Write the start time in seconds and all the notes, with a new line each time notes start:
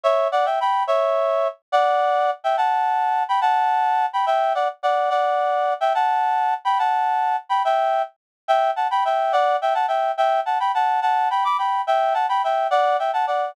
0.04 C#5 E5
0.32 D5 F#5
0.46 E5 G5
0.61 G5 B5
0.87 C#5 E5
1.72 D5 F#5
2.44 E5 G5
2.57 F#5 A5
3.29 G5 B5
3.41 F#5 A5
4.13 G5 B5
4.26 E5 G5
4.55 D5 F#5
4.83 D5 F#5
5.10 D5 F#5
5.81 E5 G5
5.95 F#5 A5
6.65 G5 B5
6.79 F#5 A5
7.49 G5 B5
7.65 E5 G5
8.48 E5 G5
8.76 F#5 A5
8.91 G5 B5
9.05 E5 G5
9.33 D5 F#5
9.62 E5 G5
9.74 F#5 A5
9.88 E5 G5
10.18 E5 G5
10.46 F#5 A5
10.60 G5 B5
10.75 F#5 A5
11.02 F#5 A5
11.30 G5 B5
11.45 B5 D6
11.58 G5 B5
11.87 E5 G5
12.14 F#5 A5
12.29 G5 B5
12.44 E5 G5
12.71 D5 F#5
12.99 E5 G5
13.13 F#5 A5
13.27 D5 F#5